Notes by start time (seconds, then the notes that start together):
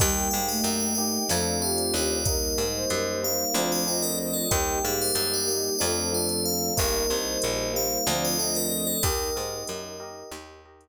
0.00 D#2 G3 A#3 D#4 G4 A#4 D#5 G5, kick, crash
0.31 G#2 A#3 D#4 G4 F5
0.48 A3 D#5
0.64 F#2 D5, closed hi-hat
0.80 D5
0.95 A#3 D#4 G4 D#5
1.29 F2 A3 C4 D4 F4 A4 C5 D5 F5, snare
1.61 A3 C4 D4 F4 G4 C5
1.78 closed hi-hat
1.94 D#2 D5
2.25 G3 A#3 D#4 G4 A#4 D#5, kick, closed hi-hat
2.58 G#2 G3 A#3 D#4
2.74 C5
2.90 F#2, closed hi-hat
3.23 G3 A#3 D#4 F5
3.54 D2 F3 A3 C4 D4 F4 A4 C5 D5, snare
3.72 D#5
3.86 F3 A3 C4 D4 D5 D#5
4.02 A#4, closed hi-hat
4.19 A#4
4.33 A4
4.51 D#2 G3 A#3 D#4 G4 A#4 D#5 G5, kick, closed hi-hat
4.83 G#2 G3 A#3 D#4 G4 F5
5.01 C5
5.15 F#2 C5, closed hi-hat
5.34 D5
5.47 G3 A#3 D#4 D#5
5.79 F2 F3 A3 C4 D4 F4 A4 C5 D5, snare
6.12 F3 A3 C4 D4 C5
6.29 closed hi-hat
6.45 F5
6.77 G1 G3 A#3 D#4 G4 A#4 D#5, kick, closed hi-hat
7.10 C2 G3 A#3 D#4
7.26 C5
7.42 A#1, closed hi-hat
7.74 G3 A#3 D#4 F5
8.06 D2 F3 A3 C4 D4 F4 A4 C5 D5, snare
8.25 D#5
8.38 F3 A3 C4 D4 D5 D#5
8.55 A#4, closed hi-hat
8.71 A#4
8.87 A4
9.03 D#2 A#3 D#4 G4 A#4 D#5, kick, closed hi-hat
9.36 G#2 G4 A#4 D#5
9.67 F#2, closed hi-hat
10.00 G4 A#4 D#5
10.31 D#2 A#3 D#4 G4 A#4 D#5, snare
10.65 G4 A#4 D#5
10.81 closed hi-hat